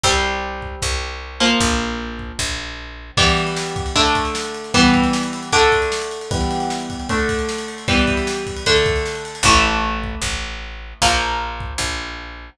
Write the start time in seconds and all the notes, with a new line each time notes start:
0.03 C2 G3 C4, kick
0.62 kick
0.82 C2, kick
1.40 F3 A#3
1.60 A#1, kick
2.19 kick
2.39 A#1, kick
3.17 E3 G3 B3, kick, crash
3.27 ride
3.37 ride
3.47 ride
3.56 snare
3.66 ride
3.76 kick, ride
3.86 ride
3.96 D3 A3 D4, kick, ride
4.05 ride
4.15 kick, ride
4.25 ride
4.35 snare
4.45 ride
4.54 ride
4.64 ride
4.74 E3 G3 B3, kick, ride
4.84 ride
4.94 kick, ride
5.04 ride
5.13 snare
5.23 ride
5.33 ride
5.43 ride
5.52 D3 A3 D4, kick, ride
5.62 ride
5.72 kick, ride
5.82 ride
5.92 snare
6.02 ride
6.11 ride
6.21 ride
6.31 E3 G3 B3, kick, ride
6.41 ride
6.51 ride
6.60 ride
6.70 snare
6.80 ride
6.90 kick, ride
7.00 ride
7.09 D3 A3 D4, kick, ride
7.19 ride
7.29 kick, ride
7.39 ride
7.49 snare
7.58 ride
7.68 ride
7.78 ride
7.88 E3 G3 B3, kick, ride
7.98 ride
8.07 kick, ride
8.17 ride
8.27 snare
8.37 ride
8.47 kick, ride
8.56 ride
8.66 D3 A3 D4, kick, ride
8.76 ride
8.86 kick, ride
8.96 ride
9.06 snare
9.15 ride
9.25 ride
9.35 ride
9.43 A1 E3 A3, kick
10.04 kick
10.22 A1, kick
11.02 A#1 F3 A#3, kick
11.60 kick
11.78 A#1, kick